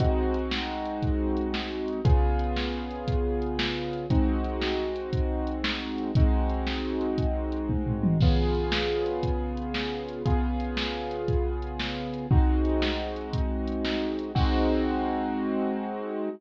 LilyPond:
<<
  \new Staff \with { instrumentName = "Acoustic Grand Piano" } { \time 12/8 \key aes \major \tempo 4. = 117 <aes c' ees' ges'>1. | <des ces' f' aes'>1. | <aes c' ees' ges'>1. | <aes c' ees' ges'>1. |
<des ces' f' aes'>1. | <des ces' f' aes'>1. | <aes c' ees' ges'>1. | <aes c' ees' ges'>1. | }
  \new DrumStaff \with { instrumentName = "Drums" } \drummode { \time 12/8 <hh bd>4 hh8 sn4 hh8 <hh bd>4 hh8 sn4 hh8 | <hh bd>4 hh8 sn4 hh8 <hh bd>4 hh8 sn4 hh8 | <hh bd>4 hh8 sn4 hh8 <hh bd>4 hh8 sn4 hh8 | <hh bd>4 hh8 sn4 hh8 <hh bd>4 hh8 <bd tommh>8 tomfh8 toml8 |
<cymc bd>4 hh8 sn4 hh8 <hh bd>4 hh8 sn4 hh8 | <hh bd>4 hh8 sn4 hh8 <hh bd>4 hh8 sn4 hh8 | bd4 hh8 sn4 hh8 <hh bd>4 hh8 sn4 hh8 | <cymc bd>4. r4. r4. r4. | }
>>